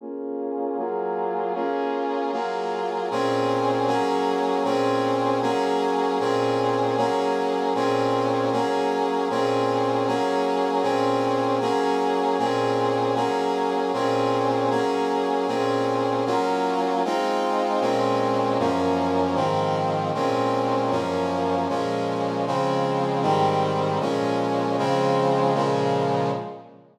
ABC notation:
X:1
M:4/4
L:1/8
Q:"Swing" 1/4=155
K:Bbm
V:1 name="Brass Section"
[B,DFA]4 [G,B,FA]4 | [B,DFA]4 [G,B,FA]4 | [B,,CDA]4 [G,B,DA]4 | [B,,CDA]4 [G,B,DA]4 |
[B,,CDA]4 [G,B,DA]4 | [B,,CDA]4 [G,B,DA]4 | [B,,CDA]4 [G,B,DA]4 | [B,,CDA]4 [G,B,DA]4 |
[B,,CDA]4 [G,B,DA]4 | [B,,CDA]4 [G,B,DA]4 | [B,,CDA]4 [G,B,DF]4 | [A,CEF]4 [B,,A,CD]4 |
[G,,F,B,D]4 [A,,E,F,C]4 | [B,,A,CD]4 [G,,F,B,D]4 | [B,,F,A,D]4 [D,F,A,C]4 | [A,,E,=G,C]4 [B,,F,A,D]4 |
[D,F,A,C]4 [B,,D,F,A,]4 |]